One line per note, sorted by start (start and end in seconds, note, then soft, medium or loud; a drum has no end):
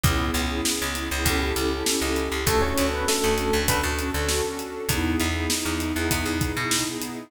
0.04 0.31 C#2 medium
0.04 0.41 B3 loud
0.04 0.41 C#4 loud
0.04 0.41 E4 loud
0.04 0.41 G#4 loud
0.04 kick loud
0.04 closed hi-hat medium
0.34 0.61 C#2 medium
0.34 snare soft
0.34 closed hi-hat medium
0.50 0.87 B3 loud
0.50 0.87 C#4 medium
0.50 0.87 E4 medium
0.50 0.87 G#4 loud
0.65 snare medium
0.82 1.09 C#2 medium
0.95 1.08 B3 loud
0.95 1.08 C#4 medium
0.95 1.08 E4 medium
0.95 1.08 G#4 medium
0.95 closed hi-hat medium
1.11 1.25 C#2 medium
1.11 1.23 B3 loud
1.11 1.23 C#4 medium
1.11 1.23 E4 loud
1.11 1.23 G#4 loud
1.25 1.53 C#2 medium
1.25 1.51 C#4 loud
1.25 1.51 E4 loud
1.25 1.51 G4 loud
1.25 1.51 A4 loud
1.25 kick medium
1.25 closed hi-hat medium
1.56 1.83 C#2 medium
1.56 1.68 C#4 loud
1.56 1.68 E4 medium
1.56 1.68 G4 loud
1.56 1.68 A4 medium
1.56 closed hi-hat medium
1.70 1.83 C#4 medium
1.70 1.83 E4 medium
1.70 1.83 G4 loud
1.70 1.83 A4 medium
1.86 1.98 C#4 loud
1.86 1.98 E4 medium
1.86 1.98 G4 medium
1.86 1.98 A4 medium
1.86 snare medium
2.02 2.29 C#2 medium
2.02 2.39 C#4 medium
2.02 2.39 E4 medium
2.02 2.39 G4 loud
2.02 2.39 A4 loud
2.16 closed hi-hat medium
2.32 2.45 C#2 medium
2.46 2.74 D2 medium
2.46 2.61 A3 medium
2.46 2.83 C#4 loud
2.46 2.83 D4 loud
2.46 2.83 F#4 loud
2.46 2.61 A4 medium
2.46 2.83 A4 loud
2.46 kick medium
2.46 closed hi-hat medium
2.62 2.87 C#4 medium
2.62 2.87 C#5 medium
2.78 3.05 D2 medium
2.78 snare soft
2.78 closed hi-hat medium
2.93 3.08 B3 medium
2.93 3.30 C#4 loud
2.93 3.30 D4 medium
2.93 3.30 F#4 loud
2.93 3.30 A4 loud
2.93 3.08 B4 medium
3.08 3.67 A3 medium
3.08 3.67 A4 medium
3.08 snare medium
3.24 3.51 D2 medium
3.37 3.49 C#4 medium
3.37 3.49 D4 medium
3.37 3.49 F#4 loud
3.37 3.49 A4 loud
3.37 closed hi-hat medium
3.53 3.67 D2 medium
3.53 3.90 C#4 medium
3.53 3.90 D4 medium
3.53 3.90 F#4 medium
3.53 3.90 A4 loud
3.68 3.82 D2 medium
3.68 3.82 B3 medium
3.68 3.82 B4 medium
3.68 kick medium
3.68 closed hi-hat medium
3.83 4.11 D2 medium
3.98 4.10 C#4 medium
3.98 4.10 D4 loud
3.98 4.10 F#4 loud
3.98 4.10 A4 medium
3.98 closed hi-hat medium
4.14 4.42 D2 medium
4.14 4.27 C#4 loud
4.14 4.27 D4 loud
4.14 4.27 F#4 loud
4.14 4.27 A4 loud
4.29 4.41 C#4 medium
4.29 4.41 D4 medium
4.29 4.41 F#4 medium
4.29 4.41 A4 medium
4.29 snare medium
4.45 4.81 C#4 medium
4.45 4.81 D4 medium
4.45 4.81 F#4 medium
4.45 4.81 A4 medium
4.59 closed hi-hat medium
4.89 5.16 E2 medium
4.89 5.26 B3 loud
4.89 5.26 D#4 loud
4.89 5.26 E4 loud
4.89 5.26 G#4 loud
4.89 kick medium
4.89 closed hi-hat medium
5.20 5.47 E2 medium
5.20 snare soft
5.20 closed hi-hat medium
5.35 5.71 B3 loud
5.35 5.71 D#4 loud
5.35 5.71 E4 loud
5.35 5.71 G#4 medium
5.50 snare medium
5.65 5.93 E2 medium
5.80 5.92 B3 loud
5.80 5.92 D#4 medium
5.80 5.92 E4 medium
5.80 5.92 G#4 medium
5.80 closed hi-hat medium
5.95 6.10 E2 medium
5.95 6.32 B3 loud
5.95 6.32 D#4 loud
5.95 6.32 E4 loud
5.95 6.32 G#4 loud
6.11 6.25 E2 medium
6.11 kick medium
6.11 closed hi-hat medium
6.26 6.53 E2 medium
6.41 6.53 B3 medium
6.41 6.53 D#4 loud
6.41 6.53 E4 loud
6.41 6.53 G#4 medium
6.41 kick medium
6.41 closed hi-hat medium
6.57 6.84 B2 medium
6.57 6.69 B3 medium
6.57 6.69 D#4 medium
6.57 6.69 E4 loud
6.57 6.69 G#4 medium
6.71 6.84 B3 medium
6.71 6.84 D#4 medium
6.71 6.84 E4 medium
6.71 6.84 G#4 medium
6.71 snare loud
6.86 7.22 B3 medium
6.86 7.22 D#4 medium
6.86 7.22 E4 medium
6.86 7.22 G#4 loud
7.02 closed hi-hat medium